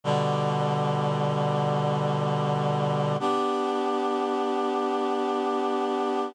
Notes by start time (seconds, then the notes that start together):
0.04 B2 D3 G3
3.20 B3 D4 G4